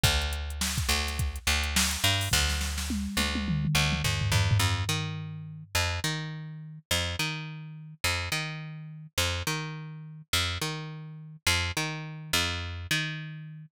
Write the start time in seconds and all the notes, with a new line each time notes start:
0.03 D2, kick, closed hi-hat
0.21 closed hi-hat
0.33 closed hi-hat
0.50 closed hi-hat
0.61 snare
0.78 kick, closed hi-hat
0.89 D2, closed hi-hat
1.07 snare, closed hi-hat
1.19 kick, closed hi-hat
1.36 closed hi-hat
1.47 D2, closed hi-hat
1.63 closed hi-hat
1.76 snare
1.91 closed hi-hat
2.04 G2, snare, closed hi-hat
2.21 open hi-hat
2.31 D2, kick, snare
2.49 snare
2.61 snare
2.78 snare
2.90 high tom
3.17 D2, high tom
3.35 high tom
3.48 mid tom
3.65 mid tom
3.75 D2
3.92 mid tom
4.04 D#2, floor tom
4.21 floor tom
4.32 E2, floor tom
4.51 floor tom
4.59 F2
4.89 D#3
5.75 F2
6.04 D#3
6.91 F2
7.19 D#3
8.04 F2
8.32 D#3
9.18 F2
9.47 D#3
10.33 F2
10.61 D#3
11.47 F2
11.77 D#3
12.33 F2
12.91 D#3